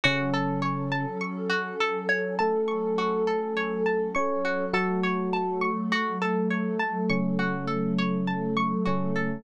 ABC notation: X:1
M:4/4
L:1/16
Q:1/4=51
K:F#dor
V:1 name="Electric Piano 1"
[C,C]4 z4 [A,A]6 [Cc]2 | [F,F]4 z4 [C,C]6 [C,C]2 |]
V:2 name="Pizzicato Strings"
F A c a c' F A c a c' F A c a c' F | A c a c' F A c a c' F A c a c' F A |]
V:3 name="Pad 2 (warm)"
[F,CA]16 | [F,A,A]16 |]